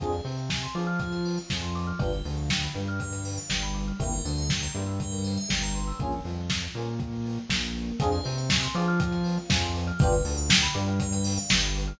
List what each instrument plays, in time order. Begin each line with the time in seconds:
0.00 synth bass 1 F2, electric piano 1 C4 D4 F4 G#4, tubular bells G#4, kick, closed hi-hat
0.12 tubular bells C5, closed hi-hat
0.24 synth bass 1 C3, electric piano 1 C4, tubular bells D5, open hi-hat
0.38 tubular bells F5, closed hi-hat
0.50 tubular bells G#5, kick, snare
0.62 tubular bells C6, closed hi-hat
0.75 synth bass 1 F3, electric piano 1 F4, tubular bells D6, open hi-hat
0.87 tubular bells F6, closed hi-hat
0.99 tubular bells G#4, kick, closed hi-hat
1.12 tubular bells C5, closed hi-hat
1.25 tubular bells D5, open hi-hat
1.38 tubular bells F5, closed hi-hat
1.50 synth bass 1 F2, electric piano 1 F3, tubular bells G#5, kick, snare
1.62 tubular bells C6, closed hi-hat
1.75 tubular bells D6, open hi-hat
1.87 tubular bells F6, closed hi-hat
1.99 synth bass 1 G1, electric piano 1 B3 D4 F4 G4, tubular bells G4, kick, closed hi-hat
2.12 tubular bells B4, closed hi-hat
2.25 synth bass 1 D2, electric piano 1 D3, tubular bells D5, open hi-hat
2.37 tubular bells F5, closed hi-hat
2.50 tubular bells G5, kick, snare
2.62 tubular bells B5, closed hi-hat
2.75 synth bass 1 G2, electric piano 1 G3, tubular bells D6, open hi-hat
2.88 tubular bells F6, closed hi-hat
3.00 tubular bells G4, kick, closed hi-hat
3.12 tubular bells B4, closed hi-hat
3.25 tubular bells D5, open hi-hat
3.38 tubular bells F5, closed hi-hat
3.49 synth bass 1 G1, electric piano 1 G3, tubular bells G5, kick, snare
3.63 tubular bells B5, closed hi-hat
3.74 tubular bells D6, open hi-hat
3.88 tubular bells F6, closed hi-hat
4.00 synth bass 1 G1, electric piano 1 A#3 C4 E4 G4, tubular bells G4, kick, closed hi-hat
4.12 tubular bells A#4, closed hi-hat
4.25 synth bass 1 D2, electric piano 1 D3, tubular bells C5, open hi-hat
4.37 tubular bells E5, closed hi-hat
4.50 tubular bells G5, kick, snare
4.62 tubular bells A#5, closed hi-hat
4.74 synth bass 1 G2, electric piano 1 G3, tubular bells C6, open hi-hat
4.87 tubular bells E6, closed hi-hat
5.00 tubular bells G4, kick, closed hi-hat
5.12 tubular bells A#4, closed hi-hat
5.24 tubular bells C5, open hi-hat
5.38 tubular bells E5, closed hi-hat
5.49 synth bass 1 G1, electric piano 1 G3, tubular bells G5, kick, snare
5.63 tubular bells A#5, closed hi-hat
5.75 tubular bells C6, open hi-hat
5.87 tubular bells E6, open hi-hat
5.99 synth bass 1 A#1, electric piano 1 A#3 C#4 F4 G#4, kick, closed hi-hat
6.12 closed hi-hat
6.24 synth bass 1 F2, electric piano 1 F3, open hi-hat
6.38 closed hi-hat
6.50 kick, snare
6.62 closed hi-hat
6.75 synth bass 1 A#2, electric piano 1 A#3, open hi-hat
6.87 closed hi-hat
7.00 kick, closed hi-hat
7.13 closed hi-hat
7.25 open hi-hat
7.37 closed hi-hat
7.49 synth bass 1 A#1, electric piano 1 A#3, kick, snare
7.62 closed hi-hat
7.75 open hi-hat
7.88 closed hi-hat
8.00 synth bass 1 F2, electric piano 1 C4 D4 F4 G#4, tubular bells G#4, kick, closed hi-hat
8.12 tubular bells C5, closed hi-hat
8.24 synth bass 1 C3, electric piano 1 C4, tubular bells D5, open hi-hat
8.38 tubular bells F5, closed hi-hat
8.50 tubular bells G#5, kick, snare
8.62 tubular bells C6, closed hi-hat
8.75 synth bass 1 F3, electric piano 1 F4, tubular bells D6, open hi-hat
8.88 tubular bells F6, closed hi-hat
9.00 tubular bells G#4, kick, closed hi-hat
9.12 tubular bells C5, closed hi-hat
9.24 tubular bells D5, open hi-hat
9.37 tubular bells F5, closed hi-hat
9.49 synth bass 1 F2, electric piano 1 F3, tubular bells G#5, kick, snare
9.62 tubular bells C6, closed hi-hat
9.74 tubular bells D6, open hi-hat
9.87 tubular bells F6, closed hi-hat
9.99 synth bass 1 G1, electric piano 1 B3 D4 F4 G4, tubular bells G4, kick, closed hi-hat
10.12 tubular bells B4, closed hi-hat
10.25 synth bass 1 D2, electric piano 1 D3, tubular bells D5, open hi-hat
10.38 tubular bells F5, closed hi-hat
10.50 tubular bells G5, kick, snare
10.62 tubular bells B5, closed hi-hat
10.74 synth bass 1 G2, electric piano 1 G3, tubular bells D6, open hi-hat
10.88 tubular bells F6, closed hi-hat
11.00 tubular bells G4, kick, closed hi-hat
11.12 tubular bells B4, closed hi-hat
11.24 tubular bells D5, open hi-hat
11.38 tubular bells F5, closed hi-hat
11.49 synth bass 1 G1, electric piano 1 G3, tubular bells G5, kick, snare
11.63 tubular bells B5, closed hi-hat
11.75 tubular bells D6, open hi-hat
11.87 tubular bells F6, closed hi-hat